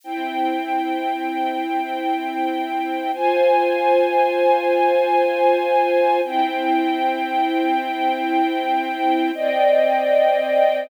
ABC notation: X:1
M:3/4
L:1/8
Q:1/4=116
K:Fm
V:1 name="String Ensemble 1"
[C=Eg]6- | [C=Eg]6 | [Fca]6- | [Fca]6 |
[C=Eg]6- | [C=Eg]6 | [K:Cm] [Cdeg]6 |]